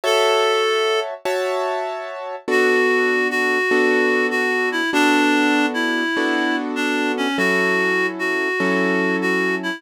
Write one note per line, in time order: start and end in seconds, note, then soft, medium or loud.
0.04 1.14 F#4 medium
0.04 1.00 A4 medium
0.04 1.14 C#5 loud
0.04 1.14 E5 loud
0.04 1.14 A5 loud
1.25 2.36 F#4 loud
1.25 2.36 C#5 loud
1.25 2.36 E5 loud
1.25 2.36 A5 loud
2.48 3.58 B3 medium
2.48 3.58 D4 loud
2.48 3.58 F#4 loud
2.48 3.28 F#4 medium
2.48 3.58 A4 loud
3.30 4.27 F#4 medium
3.71 4.81 B3 loud
3.71 4.81 D4 loud
3.71 4.81 F#4 loud
3.71 4.81 A4 loud
4.31 4.69 F#4 medium
4.72 4.90 E4 medium
4.93 6.03 B3 loud
4.93 6.03 D4 loud
4.93 5.66 D4 medium
4.93 6.03 F#4 loud
4.93 6.03 A4 medium
5.74 6.56 E4 medium
6.17 7.27 B3 loud
6.17 7.27 D4 loud
6.17 7.27 F#4 loud
6.17 7.27 A4 loud
6.76 7.12 D4 medium
7.17 7.37 C#4 medium
7.38 8.48 F#3 loud
7.38 8.48 C#4 medium
7.38 8.48 E4 loud
7.38 8.07 F#4 medium
7.38 8.48 A4 loud
8.19 9.16 F#4 medium
8.60 9.70 F#3 loud
8.60 9.70 C#4 loud
8.60 9.70 E4 medium
8.60 9.70 A4 loud
9.22 9.55 F#4 medium
9.63 9.81 E4 medium